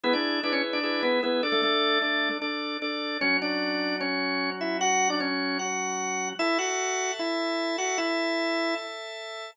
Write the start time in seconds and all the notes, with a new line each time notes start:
0.04 B3 E4 G#4 B4
0.13 D4 D5
0.43 D4 E4 G#4 B4 D5
0.53 C#4 C#5
0.73 D4 D5
0.83 E4 G#4 B4
1.03 B3 B4
1.23 B3 E4 G#4 B4
1.43 D4 A4 D5
1.52 A3 A4
1.63 A3 A4
2.02 D4 A4 D5
2.42 D4 A4 D5
2.82 D4 A4 D5
3.21 F#3 C#4 F#4 C#5
3.42 D4 D5
4.01 C#4 C#5
4.61 E4 E5
4.81 F#4 F#5
5.10 D4 D5
5.20 C#4 C#5
5.59 F#4 F#5
6.39 E4 A4 E5 A5
6.59 F#4 F#5
7.19 E4 E5
7.78 F#4 F#5
7.98 E4 E5